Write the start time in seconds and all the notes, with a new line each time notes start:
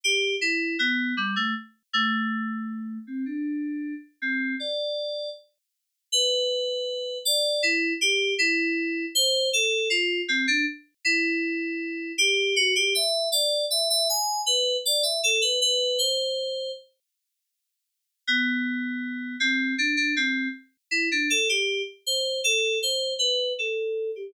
0.04 G4
0.41 E4
0.79 B3
1.17 G3
1.36 A3
1.93 A3
3.07 C4
3.26 D4
4.22 C4
4.60 D5
6.12 B4
7.25 D5
7.63 E4
8.01 G4
8.38 E4
9.15 C5
9.53 A4
9.90 F4
10.28 C4
10.47 D4
11.05 E4
12.18 G4
12.56 F#4
12.75 G4
12.95 E5
13.32 D5
13.70 E5
13.90 E5
14.09 G#5
14.46 B4
14.85 D5
15.03 E5
15.23 A4
15.41 B4
15.61 B4
15.99 C5
18.27 B3
19.40 C4
19.78 D4
19.97 D4
20.16 C4
20.91 E4
21.11 D4
21.30 A4
21.49 G4
22.06 C5
22.44 A4
22.83 C5
23.19 B4
23.59 A4
24.16 G4